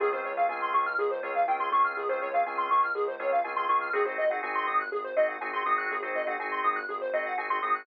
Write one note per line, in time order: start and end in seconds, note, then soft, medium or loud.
0.00 0.21 C#2 medium
0.00 0.10 C4 loud
0.00 0.10 C#4 loud
0.00 0.10 F4 loud
0.00 0.10 G#4 loud
0.00 0.11 G#4 loud
0.12 0.32 C4 medium
0.12 0.32 C#4 medium
0.12 0.32 F4 medium
0.12 0.32 G#4 medium
0.12 0.23 C5 medium
0.24 0.45 C#2 medium
0.24 0.36 C#5 medium
0.37 0.47 C4 medium
0.37 0.47 C#4 medium
0.37 0.47 F4 medium
0.37 0.47 G#4 medium
0.37 0.48 F5 medium
0.49 0.70 C#2 medium
0.49 0.88 C4 medium
0.49 0.88 C#4 medium
0.49 0.88 F4 loud
0.49 0.88 G#4 medium
0.49 0.60 G#5 medium
0.62 0.73 C6 medium
0.74 0.95 C#2 medium
0.74 0.85 C#6 medium
0.86 0.97 F6 medium
0.98 1.19 C#2 medium
0.98 1.10 G#4 loud
1.11 1.22 C5 medium
1.23 1.44 C#2 medium
1.23 1.43 C4 medium
1.23 1.43 C#4 medium
1.23 1.43 F4 loud
1.23 1.43 G#4 loud
1.23 1.34 C#5 medium
1.35 1.46 F5 medium
1.47 1.68 C#2 medium
1.47 1.58 C4 medium
1.47 1.58 C#4 loud
1.47 1.58 F4 medium
1.47 1.58 G#4 medium
1.47 1.59 G5 loud
1.60 1.69 C4 medium
1.60 1.69 C#4 medium
1.60 1.69 F4 medium
1.60 1.69 G#4 loud
1.60 1.71 C6 medium
1.72 1.93 C#2 medium
1.72 2.02 C4 medium
1.72 2.02 C#4 medium
1.72 2.02 F4 loud
1.72 2.02 G#4 medium
1.72 1.83 C#6 medium
1.84 1.95 F6 medium
1.97 2.18 C#2 medium
1.97 2.08 G#4 loud
2.09 2.29 C4 loud
2.09 2.29 C#4 medium
2.09 2.29 F4 medium
2.09 2.29 G#4 medium
2.09 2.20 C5 medium
2.21 2.43 C#2 medium
2.21 2.32 C#5 medium
2.34 2.44 C4 medium
2.34 2.44 C#4 medium
2.34 2.44 F4 medium
2.34 2.44 G#4 medium
2.34 2.45 F5 medium
2.46 2.67 C#2 medium
2.46 2.85 C4 medium
2.46 2.85 C#4 loud
2.46 2.85 F4 medium
2.46 2.85 G#4 medium
2.46 2.57 G#5 medium
2.58 2.69 C6 medium
2.70 2.91 C#2 medium
2.70 2.82 C#6 medium
2.83 2.94 F6 medium
2.95 3.15 C#2 medium
2.95 3.06 G#4 loud
3.08 3.19 C5 medium
3.19 3.40 C#2 medium
3.19 3.39 C4 medium
3.19 3.39 C#4 loud
3.19 3.39 F4 medium
3.19 3.39 G#4 medium
3.19 3.31 C#5 medium
3.32 3.43 F5 medium
3.44 3.65 C#2 medium
3.44 3.54 C4 medium
3.44 3.54 C#4 loud
3.44 3.54 F4 loud
3.44 3.54 G#4 medium
3.44 3.55 G#5 medium
3.56 3.67 C4 medium
3.56 3.67 C#4 medium
3.56 3.67 F4 medium
3.56 3.67 G#4 medium
3.56 3.67 C6 loud
3.69 3.89 C#2 medium
3.69 3.89 C4 medium
3.69 3.89 C#4 medium
3.69 3.89 F4 medium
3.69 3.89 G#4 loud
3.69 3.80 C#6 medium
3.81 3.92 F6 medium
3.93 4.15 G#1 medium
3.93 4.03 C4 loud
3.93 4.03 D#4 loud
3.93 4.03 F#4 loud
3.93 4.03 G#4 loud
3.93 4.05 G#4 loud
4.05 4.25 C4 medium
4.05 4.25 D#4 medium
4.05 4.25 F#4 medium
4.05 4.25 G#4 medium
4.05 4.17 C5 medium
4.18 4.39 G#1 medium
4.18 4.29 D#5 medium
4.30 4.41 C4 medium
4.30 4.41 D#4 loud
4.30 4.41 F#4 medium
4.30 4.41 G#4 loud
4.30 4.41 F#5 medium
4.43 4.64 G#1 medium
4.43 4.82 C4 loud
4.43 4.82 D#4 medium
4.43 4.82 F#4 medium
4.43 4.82 G#4 loud
4.43 4.54 G#5 medium
4.55 4.66 C6 medium
4.67 4.88 G#1 medium
4.67 4.78 D#6 medium
4.80 4.91 F#6 medium
4.92 5.13 G#1 medium
4.92 5.03 G#4 medium
5.04 5.15 C5 medium
5.16 5.37 G#1 medium
5.16 5.36 C4 loud
5.16 5.36 D#4 medium
5.16 5.36 F#4 medium
5.16 5.36 G#4 medium
5.16 5.27 D#5 medium
5.29 5.40 F#5 medium
5.41 5.62 G#1 medium
5.41 5.51 C4 medium
5.41 5.51 D#4 loud
5.41 5.51 F#4 medium
5.41 5.51 G#4 medium
5.41 5.52 G#5 medium
5.53 5.63 C4 medium
5.53 5.63 D#4 medium
5.53 5.63 F#4 medium
5.53 5.63 G#4 loud
5.53 5.64 C6 medium
5.65 5.86 G#1 medium
5.65 5.96 C4 medium
5.65 5.96 D#4 medium
5.65 5.96 F#4 loud
5.65 5.96 G#4 loud
5.65 5.77 D#6 medium
5.78 5.89 F#6 medium
5.90 6.12 G#1 medium
5.90 6.01 G#4 medium
6.02 6.22 C4 medium
6.02 6.22 D#4 medium
6.02 6.22 F#4 medium
6.02 6.22 G#4 loud
6.02 6.13 C5 medium
6.15 6.36 G#1 medium
6.15 6.26 D#5 medium
6.27 6.36 C4 loud
6.27 6.36 D#4 medium
6.27 6.36 F#4 medium
6.27 6.36 G#4 loud
6.27 6.38 F#5 medium
6.39 6.60 G#1 medium
6.39 6.79 C4 medium
6.39 6.79 D#4 medium
6.39 6.79 F#4 medium
6.39 6.79 G#4 loud
6.39 6.51 G#5 medium
6.51 6.62 C6 medium
6.64 6.85 G#1 medium
6.64 6.75 D#6 medium
6.76 6.87 F#6 medium
6.89 7.10 G#1 medium
6.89 7.00 G#4 medium
7.01 7.12 C5 medium
7.13 7.34 G#1 medium
7.13 7.33 C4 medium
7.13 7.33 D#4 medium
7.13 7.33 F#4 medium
7.13 7.33 G#4 medium
7.13 7.24 D#5 medium
7.26 7.37 F#5 loud
7.37 7.59 G#1 medium
7.37 7.47 C4 medium
7.37 7.47 D#4 medium
7.37 7.47 F#4 medium
7.37 7.47 G#4 medium
7.37 7.49 G#5 medium
7.50 7.60 C4 medium
7.50 7.60 D#4 medium
7.50 7.60 F#4 medium
7.50 7.60 G#4 medium
7.50 7.61 C6 medium
7.62 7.84 G#1 medium
7.62 7.82 C4 medium
7.62 7.82 D#4 medium
7.62 7.82 F#4 medium
7.62 7.82 G#4 medium
7.62 7.73 D#6 medium
7.75 7.86 F#6 medium